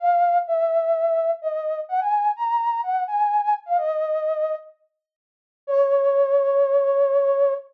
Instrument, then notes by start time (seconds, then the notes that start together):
flute
0.00 F5
0.47 E5
1.42 D#5
1.89 F#5
2.01 G#5
2.36 A#5
2.83 F#5
3.07 G#5
3.42 G#5
3.66 F5
3.78 D#5
5.67 C#5